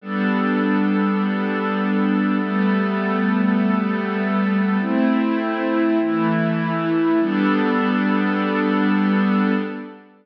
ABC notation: X:1
M:6/8
L:1/8
Q:3/8=50
K:G
V:1 name="Pad 5 (bowed)"
[G,B,DA]6 | [G,A,B,A]6 | [A,CE]3 [E,A,E]3 | [G,B,DA]6 |]